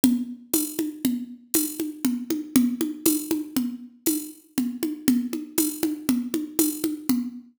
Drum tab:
TB |--x---x---|--x---x---|--x---x---|
CG |O-ooO-ooOo|OoooO-o-Oo|OoooOoooO-|